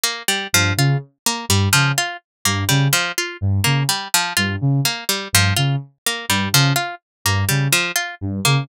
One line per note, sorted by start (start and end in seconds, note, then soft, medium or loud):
0.04 0.23 A#3 medium
0.28 0.47 G3 medium
0.53 0.72 G2 medium
0.53 0.73 F3 medium
0.77 0.96 C#3 medium
0.77 0.98 F4 medium
1.26 1.45 A#3 medium
1.49 1.68 G2 medium
1.49 1.69 G3 medium
1.73 1.92 C#3 medium
1.73 1.92 F3 medium
1.98 2.17 F4 medium
2.45 2.64 G2 medium
2.45 2.64 A#3 medium
2.69 2.88 C#3 medium
2.69 2.88 G3 medium
2.93 3.12 F3 medium
3.18 3.37 F4 medium
3.41 3.60 G2 medium
3.64 3.84 C#3 medium
3.64 3.83 A#3 medium
3.89 4.08 G3 medium
4.14 4.33 F3 medium
4.37 4.56 G2 medium
4.37 4.56 F4 medium
4.61 4.80 C#3 medium
4.85 5.04 A#3 medium
5.09 5.28 G3 medium
5.33 5.52 G2 medium
5.33 5.54 F3 medium
5.57 5.76 C#3 medium
5.57 5.76 F4 medium
6.06 6.26 A#3 medium
6.29 6.48 G2 medium
6.29 6.49 G3 medium
6.53 6.72 C#3 medium
6.53 6.73 F3 medium
6.76 6.95 F4 medium
7.25 7.44 G2 medium
7.25 7.45 A#3 medium
7.49 7.68 C#3 medium
7.49 7.68 G3 medium
7.72 7.92 F3 medium
7.96 8.15 F4 medium
8.21 8.40 G2 medium
8.45 8.64 C#3 medium
8.45 8.64 A#3 medium